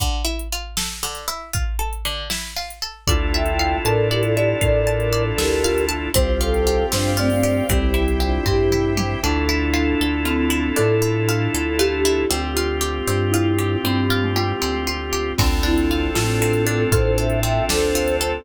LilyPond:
<<
  \new Staff \with { instrumentName = "Flute" } { \time 6/8 \key d \minor \tempo 4. = 78 r2. | r2. | r8 <e'' g''>4 <bes' d''>8 <g' bes'>16 <f' a'>16 <e' g'>8 | <bes' d''>4. <g' bes'>4 r8 |
r8 <f' a'>4 <d' f'>8 <a c'>16 <a c'>16 <a c'>8 | <a c'>8 <c' e'>8 <d' f'>8 <e' g'>4 r8 | r2. | r2. |
r2. | r2. | r8 <c' e'>4 <a c'>8 <a c'>16 <a c'>16 <a c'>8 | <a' c''>8 <c'' e''>8 <e'' g''>8 <a' c''>4 <a' c''>8 | }
  \new Staff \with { instrumentName = "Marimba" } { \time 6/8 \key d \minor r2. | r2. | f'4. a'8 d''8 d''8 | a'4 r8 a'8 f'4 |
c''4. c''8 d''8 d''8 | g'4 r2 | d'2 c'4 | a'2 g'4 |
f'2 e'4 | c'8. a16 f'4 r4 | c'4. f'8 a'8 a'8 | a'4. r4. | }
  \new Staff \with { instrumentName = "Drawbar Organ" } { \time 6/8 \key d \minor r2. | r2. | <d' e' f' a'>2.~ | <d' e' f' a'>2. |
<c' f' g'>2. | <c' e' g'>2. | <d' e' f' a'>2.~ | <d' e' f' a'>2. |
<c' f' g'>2.~ | <c' f' g'>2. | <c' d' f' a'>2.~ | <c' d' f' a'>2. | }
  \new Staff \with { instrumentName = "Pizzicato Strings" } { \time 6/8 \key d \minor d8 e'8 f'8 a'8 d8 e'8 | f'8 a'8 d8 e'8 f'8 a'8 | d''8 e''8 f''8 a''8 d''8 e''8 | f''8 a''8 d''8 e''8 f''8 a''8 |
c'8 f'8 g'8 c'8 f'8 g'8 | c'8 e'8 g'8 c'8 e'8 g'8 | d'8 e'8 f'8 a'8 f'8 e'8 | d'8 e'8 f'8 a'8 f'8 e'8 |
c'8 f'8 g'8 c'8 f'8 g'8 | c'8 f'8 g'8 c'8 f'8 g'8 | c'8 d'8 f'8 a'8 c'8 d'8 | f'8 a'8 c'8 d'8 f'8 a'8 | }
  \new Staff \with { instrumentName = "Synth Bass 1" } { \clef bass \time 6/8 \key d \minor r2. | r2. | d,4. a,4. | a,4. d,4. |
c,4. g,4. | c,4. g,4. | d,4. d,4. | a,4. d,4. |
d,4. g,4. | g,4. d,4. | d,4. a,4. | a,4. d,4. | }
  \new Staff \with { instrumentName = "String Ensemble 1" } { \time 6/8 \key d \minor r2. | r2. | <d' e' f' a'>2.~ | <d' e' f' a'>2. |
<c'' f'' g''>2. | <c'' e'' g''>2. | <d' e' f' a'>2.~ | <d' e' f' a'>2. |
<c' f' g'>2.~ | <c' f' g'>2. | <c' d' f' a'>2.~ | <c' d' f' a'>2. | }
  \new DrumStaff \with { instrumentName = "Drums" } \drummode { \time 6/8 <hh bd>8. hh8. sn8. hh8. | <hh bd>8. hh8. sn8. hh8. | <hh bd>8. hh8. hh8. hh8. | <hh bd>8. hh8. sn8. hh8. |
<hh bd>8. hh8. sn8. hho8. | <hh bd>8. hh8. <bd tomfh>8 toml8 tommh8 | r4. r4. | r4. r4. |
r4. r4. | r4. r4. | <cymc bd>8. hh8. sn8. hh8. | <hh bd>8. hh8. sn8. hh8. | }
>>